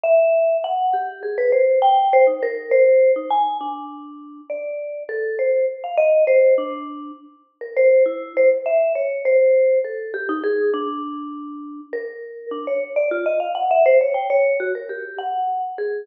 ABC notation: X:1
M:9/8
L:1/16
Q:3/8=67
K:none
V:1 name="Vibraphone"
e4 _g2 =G2 _A B c2 =g2 c _E _B2 | c3 _E _a2 D6 d4 =A2 | c2 z f _e2 c2 D4 z3 _B c2 | E2 c z e2 _d2 c4 A2 G _E _A2 |
D8 _B4 D _d z =d F _e | f _g e c _d =g d2 _G _B =G2 _g3 z _A2 |]